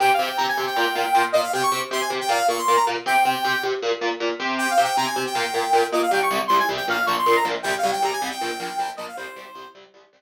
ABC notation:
X:1
M:4/4
L:1/16
Q:1/4=157
K:Cphr
V:1 name="Lead 2 (sawtooth)"
(3g2 f2 g2 b a2 g7 e f | g d'2 z c' a z g f2 d' c'2 b z2 | g6 z10 | (3g2 f2 g2 b a2 g7 e f |
g d'2 z c' a z g f2 d' c'2 b z2 | (3g2 f2 g2 b a2 g7 e f | c6 z10 |]
V:2 name="Overdriven Guitar"
[C,CG]2 [C,CG]2 [C,CG]2 [C,CG]2 [B,,B,F]2 [B,,B,F]2 [B,,B,F]2 [B,,B,F]2 | [C,CG]2 [C,CG]2 [C,CG]2 [C,CG]2 [B,,B,F]2 [B,,B,F]2 [B,,B,F]2 [B,,B,F]2 | [C,CG]2 [C,CG]2 [C,CG]2 [C,CG]2 [B,,B,F]2 [B,,B,F]2 [B,,B,F]2 [C,CG]2- | [C,CG]2 [C,CG]2 [C,CG]2 [C,CG]2 [B,,B,F]2 [B,,B,F]2 [B,,B,F]2 [B,,B,F]2 |
[C,,C,G,]2 [C,,C,G,]2 [C,,C,G,]2 [C,,C,G,]2 [B,,,B,,F,]2 [B,,,B,,F,]2 [B,,,B,,F,]2 [B,,,B,,F,]2 | [C,,C,G,]2 [C,,C,G,]2 [C,,C,G,]2 [C,,C,G,]2 [B,,,B,,F,]2 [B,,,B,,F,]2 [B,,,B,,F,]2 [B,,,B,,F,]2 | [C,,C,G,]2 [C,,C,G,]2 [C,,C,G,]2 [C,,C,G,]2 [C,,C,G,]2 [C,,C,G,]2 z4 |]